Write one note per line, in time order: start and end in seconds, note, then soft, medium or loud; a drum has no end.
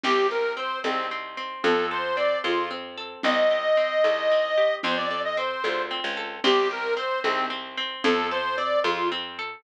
0.03 0.76 C2 medium
0.03 0.56 C4 loud
0.03 0.27 G4 loud
0.03 crash loud
0.03 low conga medium
0.30 1.58 G4 medium
0.30 0.52 A#4 medium
0.57 1.10 C4 medium
0.57 0.79 C5 medium
0.84 1.56 C2 medium
0.84 1.06 C4 medium
0.84 1.60 D#4 medium
0.84 high conga medium
1.11 1.36 C4 medium
1.37 2.16 C4 loud
1.63 2.36 F2 loud
1.63 1.86 A4 loud
1.63 low conga loud
1.91 2.97 A4 medium
1.91 2.16 C5 medium
2.16 2.70 C4 medium
2.16 2.39 D5 medium
2.44 3.16 F2 medium
2.44 3.20 F4 medium
2.44 2.69 F4 medium
2.44 high conga medium
2.70 3.21 C4 medium
2.97 3.23 A4 medium
3.23 3.96 C2 loud
3.23 3.76 C4 loud
3.23 4.75 D#5 loud
3.23 low conga loud
3.51 4.57 G4 medium
3.77 4.31 C4 loud
4.04 4.76 C2 medium
4.04 4.80 D#4 medium
4.04 high conga medium
4.31 4.82 C4 medium
4.57 4.83 G4 medium
4.83 5.56 F2 loud
4.83 5.37 C4 loud
4.83 4.96 C5 loud
4.83 low conga medium
4.97 5.09 D5 medium
5.09 6.16 A4 medium
5.09 5.22 D5 medium
5.24 5.37 D#5 medium
5.37 5.90 C4 medium
5.37 5.82 C5 medium
5.64 6.00 D2 medium
5.64 6.41 F4 medium
5.64 high conga medium
5.90 6.41 C4 loud
6.04 6.40 C#2 medium
6.17 6.42 A4 medium
6.44 7.16 C2 medium
6.44 6.71 C4 loud
6.44 6.68 G4 loud
6.44 crash loud
6.44 low conga loud
6.71 6.97 G4 medium
6.71 6.94 A#4 loud
6.96 7.23 C4 medium
6.96 7.20 C5 medium
7.24 7.96 C2 medium
7.24 7.45 C4 medium
7.24 7.51 D#4 medium
7.24 high conga loud
7.50 7.76 C4 medium
7.77 8.31 C4 loud
8.04 8.76 F2 loud
8.04 8.27 A4 loud
8.04 low conga loud
8.31 8.58 A4 medium
8.31 8.56 C5 loud
8.57 8.84 C4 medium
8.57 8.80 D5 medium
8.84 9.56 F2 loud
8.84 9.11 F4 medium
8.84 9.08 F4 medium
8.84 high conga medium
9.11 9.38 C4 loud
9.39 9.63 A4 loud